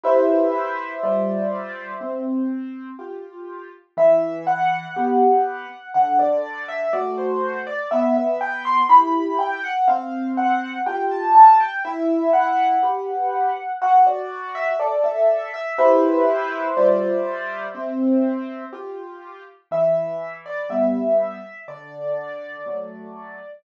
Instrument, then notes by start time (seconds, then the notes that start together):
acoustic grand piano
0.03 E4 G4 B4 C5 E5
1.03 G3 F4 C5 D5
2.01 C4
2.99 F4 G4
3.97 E3 E5
4.47 F#5
4.96 B3 G4
5.94 D3 F#5
6.19 D5
6.68 E5
6.93 A3 F#4 D5
7.18 C5
7.67 D5
7.91 B3 E5
8.16 E5
8.41 G5
8.65 C6
8.89 E4 G4 B5
9.39 G5
9.64 F#5
9.88 C4 F5
10.37 F#5
10.86 F4 G4 G5
11.11 A5
11.35 A5
11.60 G5
11.85 E4 E5
12.33 F#5
12.83 G4 B4
13.82 F#4 F#5
14.07 D5
14.55 E5
14.80 A4 D5
15.04 E5
15.54 E5
15.78 E4 G4 B4 C5 E5
16.77 G3 F4 C5 D5
17.75 C4
18.73 F4 G4
19.71 E3 E5
20.46 D5
20.69 G3 B3 E5
21.68 D3 D5
22.66 F#3 A3